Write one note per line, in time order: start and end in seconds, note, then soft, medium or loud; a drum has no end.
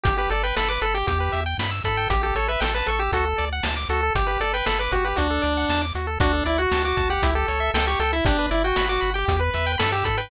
0.04 0.27 G1 loud
0.04 0.15 G4 loud
0.04 0.17 G4 medium
0.04 kick loud
0.04 closed hi-hat loud
0.18 0.30 G4 medium
0.18 0.30 B4 medium
0.30 0.53 G1 medium
0.30 0.43 A4 medium
0.30 0.43 D5 medium
0.30 closed hi-hat medium
0.43 0.56 B4 medium
0.43 0.55 G5 medium
0.57 0.78 G1 medium
0.57 0.69 A4 medium
0.57 0.68 B5 medium
0.57 snare loud
0.69 0.82 B4 medium
0.69 0.80 D6 medium
0.81 1.04 G1 medium
0.81 0.94 A4 medium
0.81 0.93 B5 medium
0.81 closed hi-hat medium
0.94 1.07 G4 medium
0.94 1.07 G5 medium
1.07 1.29 E2 loud
1.07 1.19 G4 loud
1.07 1.41 G4 medium
1.07 kick medium
1.07 closed hi-hat loud
1.20 1.32 B4 medium
1.32 1.55 E2 medium
1.32 1.44 E5 medium
1.32 closed hi-hat medium
1.46 1.57 G5 medium
1.58 1.81 G2 medium
1.58 1.71 B5 medium
1.58 snare loud
1.71 1.83 E6 medium
1.84 2.07 G#2 medium
1.84 2.08 A4 medium
1.84 1.96 B5 medium
1.84 kick medium
1.84 closed hi-hat medium
1.97 2.09 G5 medium
2.10 2.32 A1 loud
2.10 2.21 G4 medium
2.10 2.22 G4 medium
2.10 kick loud
2.10 closed hi-hat loud
2.23 2.35 G4 medium
2.23 2.34 A4 medium
2.35 2.57 A1 medium
2.35 2.48 A4 medium
2.35 2.47 C#5 medium
2.35 closed hi-hat medium
2.48 2.60 B4 medium
2.48 2.61 E5 medium
2.60 2.83 A1 medium
2.60 2.74 A4 medium
2.60 2.72 G5 medium
2.60 snare loud
2.75 2.87 B4 medium
2.75 2.87 A5 medium
2.86 3.10 A1 medium
2.86 2.99 A4 medium
2.86 3.00 C#6 medium
2.86 closed hi-hat medium
2.99 3.12 G4 medium
2.99 3.11 E6 medium
3.12 3.34 D2 loud
3.12 3.25 F#4 loud
3.12 3.45 A4 medium
3.12 kick medium
3.12 closed hi-hat loud
3.25 3.36 A4 medium
3.38 3.61 D2 medium
3.38 3.50 D5 medium
3.38 closed hi-hat medium
3.53 3.64 F#5 medium
3.63 3.86 D2 medium
3.63 3.75 A5 medium
3.63 snare loud
3.77 3.88 D6 medium
3.89 4.11 D2 loud
3.89 4.01 F#4 medium
3.89 4.13 A4 medium
3.89 closed hi-hat medium
4.03 4.15 A4 medium
4.15 4.37 G1 loud
4.15 4.28 G4 medium
4.15 4.27 G4 medium
4.15 kick loud
4.15 closed hi-hat loud
4.27 4.40 G4 medium
4.27 4.38 B4 medium
4.40 4.62 G1 medium
4.40 4.53 A4 medium
4.40 4.52 D5 medium
4.40 closed hi-hat medium
4.54 4.66 B4 medium
4.54 4.66 G5 medium
4.66 4.89 G1 medium
4.66 4.79 A4 medium
4.66 4.78 B5 medium
4.66 snare loud
4.79 4.91 B4 medium
4.79 4.92 D6 medium
4.92 5.14 G1 loud
4.92 5.05 F#4 medium
4.92 5.04 G4 medium
4.92 kick medium
4.92 closed hi-hat medium
5.05 5.18 G4 medium
5.05 5.16 B4 medium
5.16 5.40 D2 loud
5.16 5.82 D4 medium
5.16 5.28 F#4 medium
5.16 kick medium
5.16 closed hi-hat loud
5.30 5.42 A4 medium
5.42 5.65 D2 loud
5.42 5.54 D5 medium
5.42 closed hi-hat medium
5.57 5.69 F#5 medium
5.69 5.92 E2 medium
5.69 5.82 A5 medium
5.69 snare loud
5.82 5.93 D6 medium
5.95 6.18 D#2 medium
5.95 6.07 F#4 medium
5.95 closed hi-hat medium
6.07 6.19 A4 medium
6.20 6.42 D2 loud
6.20 6.44 D4 medium
6.20 6.32 F#4 loud
6.20 kick loud
6.20 closed hi-hat loud
6.33 6.44 A4 medium
6.45 6.67 D2 loud
6.45 6.58 E4 medium
6.45 6.57 D5 medium
6.45 closed hi-hat medium
6.58 6.83 F#4 medium
6.58 6.70 F#5 medium
6.72 6.93 D2 loud
6.72 6.84 A5 medium
6.72 snare loud
6.85 7.10 F#4 medium
6.85 6.97 D6 medium
6.97 7.19 D2 medium
6.97 7.08 A5 medium
6.97 kick loud
6.97 closed hi-hat medium
7.10 7.31 G4 medium
7.10 7.22 F#5 medium
7.23 7.44 C#2 loud
7.23 7.35 E4 loud
7.23 kick loud
7.23 closed hi-hat loud
7.35 7.47 G4 loud
7.35 7.71 A4 medium
7.48 7.71 C#2 medium
7.48 7.60 C#5 medium
7.48 closed hi-hat medium
7.60 7.72 E5 medium
7.74 7.96 C#2 loud
7.74 7.87 A4 medium
7.74 7.86 G5 medium
7.74 snare loud
7.87 7.99 G4 medium
7.87 7.99 C#6 loud
7.99 8.21 C#2 loud
7.99 8.12 A4 medium
7.99 8.11 G5 medium
7.99 closed hi-hat medium
8.13 8.25 E4 medium
8.13 8.24 E5 medium
8.25 8.47 G1 loud
8.25 8.46 D4 medium
8.25 8.37 G4 loud
8.25 kick loud
8.25 closed hi-hat loud
8.39 8.50 B4 medium
8.51 8.73 G1 loud
8.51 8.63 E4 medium
8.51 8.62 D5 medium
8.51 closed hi-hat medium
8.64 8.86 F#4 medium
8.64 8.76 G5 medium
8.76 8.99 G1 loud
8.76 8.89 B5 loud
8.76 snare loud
8.89 9.10 F#4 medium
8.89 9.01 D6 loud
9.01 9.24 G1 loud
9.01 9.13 B5 medium
9.01 closed hi-hat medium
9.14 9.37 G4 medium
9.14 9.26 G5 medium
9.28 9.50 E2 loud
9.28 9.40 G4 loud
9.28 kick loud
9.28 closed hi-hat loud
9.39 9.51 B4 medium
9.39 9.72 B4 medium
9.54 9.76 E2 loud
9.54 9.66 E5 medium
9.54 closed hi-hat medium
9.67 9.78 G5 loud
9.78 10.03 G2 loud
9.78 9.92 A4 medium
9.78 9.90 B5 medium
9.78 snare loud
9.92 10.04 G4 medium
9.92 10.04 E6 medium
10.04 10.28 G#2 medium
10.04 10.17 A4 medium
10.04 10.16 B5 medium
10.04 kick loud
10.04 closed hi-hat loud
10.18 10.30 B4 medium
10.18 10.29 G5 medium